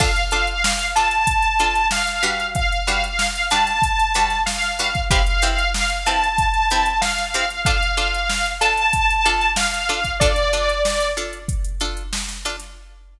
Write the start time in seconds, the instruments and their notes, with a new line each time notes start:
0.00 pizzicato strings D4 F4 A4, lead 2 (sawtooth) F5, kick, crash
0.16 closed hi-hat
0.31 pizzicato strings D4 F4 A4, closed hi-hat
0.47 closed hi-hat
0.64 snare
0.79 closed hi-hat
0.96 pizzicato strings D4 F4 A4, lead 2 (sawtooth) A5, closed hi-hat
1.11 closed hi-hat
1.27 kick, closed hi-hat
1.42 closed hi-hat
1.59 pizzicato strings D4 F4 A4, closed hi-hat
1.75 closed hi-hat
1.91 lead 2 (sawtooth) F5, snare
2.07 snare, closed hi-hat
2.23 pizzicato strings G3 D4 F#4 B4, closed hi-hat
2.40 closed hi-hat
2.55 lead 2 (sawtooth) F5, kick, closed hi-hat
2.72 closed hi-hat
2.87 pizzicato strings G3 D4 F#4 B4, closed hi-hat
3.04 closed hi-hat
3.19 snare
3.36 closed hi-hat
3.50 pizzicato strings G3 D4 F#4 B4, lead 2 (sawtooth) A5, closed hi-hat
3.67 snare, closed hi-hat
3.82 kick, closed hi-hat
3.99 closed hi-hat
4.14 pizzicato strings G3 D4 F#4 B4, closed hi-hat
4.30 snare, closed hi-hat
4.46 lead 2 (sawtooth) F5, snare
4.62 snare, closed hi-hat
4.79 pizzicato strings G3 D4 F#4 B4, closed hi-hat
4.95 kick, closed hi-hat
5.11 pizzicato strings C4 E4 G4 B4, lead 2 (sawtooth) F5, kick, closed hi-hat
5.27 closed hi-hat
5.42 pizzicato strings C4 E4 G4 B4, closed hi-hat
5.59 closed hi-hat
5.74 snare
5.90 closed hi-hat
6.06 pizzicato strings C4 E4 G4 B4, lead 2 (sawtooth) A5, closed hi-hat
6.24 closed hi-hat
6.38 kick, closed hi-hat
6.54 closed hi-hat
6.70 pizzicato strings C4 E4 G4 B4, closed hi-hat
6.86 closed hi-hat
7.01 lead 2 (sawtooth) F5, snare
7.18 snare, closed hi-hat
7.34 pizzicato strings C4 E4 G4 B4, closed hi-hat
7.50 snare, closed hi-hat
7.65 pizzicato strings D4 F4 A4, lead 2 (sawtooth) F5, kick, closed hi-hat
7.83 closed hi-hat
7.97 pizzicato strings D4 F4 A4, closed hi-hat
8.14 closed hi-hat
8.29 snare
8.46 closed hi-hat
8.61 pizzicato strings D4 F4 A4, lead 2 (sawtooth) A5, closed hi-hat
8.77 closed hi-hat
8.93 kick, closed hi-hat
9.10 closed hi-hat
9.26 pizzicato strings D4 F4 A4, closed hi-hat
9.41 closed hi-hat
9.56 lead 2 (sawtooth) F5, snare
9.74 snare, closed hi-hat
9.89 pizzicato strings D4 F4 A4, closed hi-hat
10.05 kick, closed hi-hat
10.20 pizzicato strings D4 F4 A4, lead 2 (sawtooth) D5, kick, closed hi-hat
10.36 closed hi-hat
10.53 pizzicato strings D4 F4 A4, snare, closed hi-hat
10.69 closed hi-hat
10.85 snare
11.00 snare, closed hi-hat
11.17 pizzicato strings D4 F4 A4, closed hi-hat
11.33 closed hi-hat
11.48 kick, closed hi-hat
11.64 closed hi-hat
11.80 pizzicato strings D4 F4 A4, closed hi-hat
11.97 closed hi-hat
12.13 snare
12.29 snare, closed hi-hat
12.45 pizzicato strings D4 F4 A4, closed hi-hat
12.60 snare, closed hi-hat